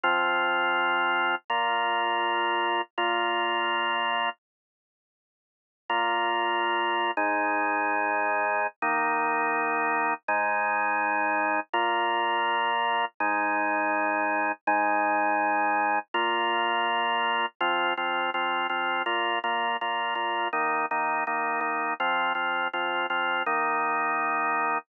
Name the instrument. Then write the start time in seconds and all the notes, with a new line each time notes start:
drawbar organ
0.04 F3 C4 F4
1.50 A#2 A#3 F4
2.98 A#2 A#3 F4
5.89 A#2 A#3 F4
7.17 G#2 G#3 D#4
8.82 D#3 A#3 D#4
10.28 G#2 G#3 D#4
11.73 A#2 A#3 F4
13.20 G#2 G#3 D#4
14.67 G#2 G#3 D#4
16.14 A#2 A#3 F4
17.61 F3 C4 F4
17.97 F3 C4 F4
18.34 F3 C4 F4
18.69 F3 C4 F4
19.06 A#2 A#3 F4
19.44 A#2 A#3 F4
19.81 A#2 A#3 F4
20.15 A#2 A#3 F4
20.53 D#3 A#3 D#4
20.91 D#3 A#3 D#4
21.27 D#3 A#3 D#4
21.61 D#3 A#3 D#4
22.00 F3 C4 F4
22.35 F3 C4 F4
22.73 F3 C4 F4
23.10 F3 C4 F4
23.46 D#3 A#3 D#4